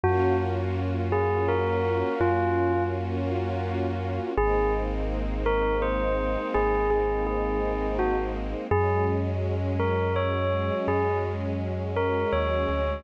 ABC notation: X:1
M:3/4
L:1/16
Q:1/4=83
K:Abmix
V:1 name="Tubular Bells"
G2 z4 A2 B4 | F4 z8 | A2 z4 B2 c4 | A2 A2 A4 G z3 |
A2 z4 B2 d4 | A2 z4 B2 d4 |]
V:2 name="Synth Bass 2" clef=bass
G,,12 | G,,12 | A,,,12 | A,,,12 |
G,,12 | G,,8 E,,2 =D,,2 |]
V:3 name="String Ensemble 1"
[B,DFG]12- | [B,DFG]12 | [A,B,CE]12- | [A,B,CE]12 |
[G,A,D]12- | [G,A,D]12 |]